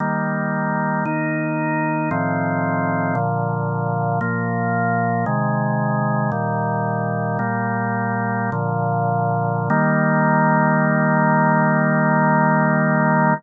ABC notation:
X:1
M:3/4
L:1/8
Q:1/4=57
K:Eb
V:1 name="Drawbar Organ"
[E,G,B,]2 [E,B,E]2 [=A,,E,F,C]2 | [B,,D,F,]2 [B,,F,B,]2 [C,E,A,]2 | "^rit." [B,,E,G,]2 [B,,G,B,]2 [B,,D,F,]2 | [E,G,B,]6 |]